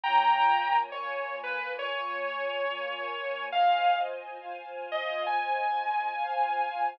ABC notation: X:1
M:4/4
L:1/8
Q:"Swing" 1/4=69
K:Fm
V:1 name="Distortion Guitar"
[gb]2 d =B d4 | f z2 e a4 |]
V:2 name="String Ensemble 1"
[B,Fda]2 [B,FBa]2 [B,Fda]2 [B,FBa]2 | [Fcea]2 [Fcfa]2 [Fcea]2 [Fcfa]2 |]